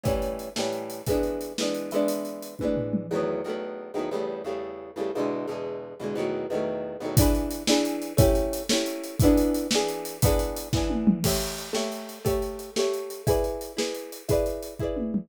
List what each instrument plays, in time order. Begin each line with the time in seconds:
0.03 acoustic guitar (steel) A2 E3 G3 C#4, kick, closed hi-hat
0.22 closed hi-hat
0.39 closed hi-hat
0.56 acoustic guitar (steel) A2 E3 G3 C#4, snare
0.73 closed hi-hat
0.90 closed hi-hat
1.06 acoustic guitar (steel) E3 G#3 B3, kick, closed hi-hat
1.11 acoustic guitar (steel) D4
1.23 closed hi-hat
1.41 closed hi-hat
1.58 acoustic guitar (steel) E3 G#3 B3, snare
1.62 acoustic guitar (steel) D4
1.75 closed hi-hat
1.91 acoustic guitar (steel) E3 G#3 B3, closed hi-hat
1.96 acoustic guitar (steel) D4
2.08 closed hi-hat
2.25 closed hi-hat
2.42 closed hi-hat
2.59 acoustic guitar (steel) E3 G#3, kick, high tom
2.63 acoustic guitar (steel) B3 D4
2.77 floor tom
2.93 mid tom
3.11 acoustic guitar (steel) E2 D#3 F#3 A3
3.16 acoustic guitar (steel) B3
3.44 acoustic guitar (steel) E2 D#3 F#3 A3
3.49 acoustic guitar (steel) B3
3.94 acoustic guitar (steel) E2 D#3 F#3 A3
3.99 acoustic guitar (steel) B3
4.11 acoustic guitar (steel) E2 C#3 G3 A3
4.44 acoustic guitar (steel) E2 C#3 G3 A3
4.96 acoustic guitar (steel) E2 C#3 G3 A3
5.15 acoustic guitar (steel) E2 B2 D3 G#3
5.47 acoustic guitar (steel) E2 B2 D3 G#3
6.00 acoustic guitar (steel) E2 B2 D3 G#3
6.15 acoustic guitar (steel) E2 B2 D#3 F#3
6.20 acoustic guitar (steel) A3
6.50 acoustic guitar (steel) E2 B2 D#3 F#3
6.55 acoustic guitar (steel) A3
7.00 acoustic guitar (steel) E2 B2 D#3 F#3
7.05 acoustic guitar (steel) A3
7.17 acoustic guitar (steel) E3 D4 G#4, kick, closed hi-hat
7.22 acoustic guitar (steel) B4
7.35 closed hi-hat
7.51 closed hi-hat
7.67 acoustic guitar (steel) E3 D4 G#4 B4, snare
7.85 closed hi-hat
8.02 closed hi-hat
8.17 acoustic guitar (steel) A3 C#4 E4 G4, kick, closed hi-hat
8.35 closed hi-hat
8.53 closed hi-hat
8.69 acoustic guitar (steel) A3 C#4 E4, snare
8.74 acoustic guitar (steel) G4
8.86 closed hi-hat
9.04 closed hi-hat
9.20 acoustic guitar (steel) E3 B3, kick, closed hi-hat
9.24 acoustic guitar (steel) D4 G#4
9.37 closed hi-hat
9.54 closed hi-hat
9.71 acoustic guitar (steel) E3 B3 D4, snare
9.75 acoustic guitar (steel) G#4
9.88 closed hi-hat
10.05 closed hi-hat
10.22 acoustic guitar (steel) E3 B3 D4, kick, closed hi-hat
10.26 acoustic guitar (steel) G#4
10.39 closed hi-hat
10.56 closed hi-hat
10.73 acoustic guitar (steel) E3 B3 D4, kick, snare
10.77 acoustic guitar (steel) G#4
10.90 high tom
11.07 mid tom
11.24 acoustic guitar (steel) A3 G4 C#5 E5, kick, crash
11.41 closed hi-hat
11.58 closed hi-hat
11.73 acoustic guitar (steel) A3 G4 C#5 E5, snare
11.92 closed hi-hat
12.09 closed hi-hat
12.25 acoustic guitar (steel) A3 G4 C#5 E5, kick, closed hi-hat
12.42 closed hi-hat
12.59 closed hi-hat
12.76 acoustic guitar (steel) A3 G4 C#5, snare
12.80 acoustic guitar (steel) E5
12.94 closed hi-hat
13.10 closed hi-hat
13.27 acoustic guitar (steel) E4 G#4 B4 D5, kick, closed hi-hat
13.44 closed hi-hat
13.61 closed hi-hat
13.77 acoustic guitar (steel) E4 G#4 B4 D5, snare
13.94 closed hi-hat
14.12 closed hi-hat
14.28 acoustic guitar (steel) E4 G#4 B4 D5, kick, closed hi-hat
14.46 closed hi-hat
14.62 closed hi-hat
14.79 acoustic guitar (steel) E4 G#4 B4, kick
14.84 acoustic guitar (steel) D5
14.97 high tom
15.14 mid tom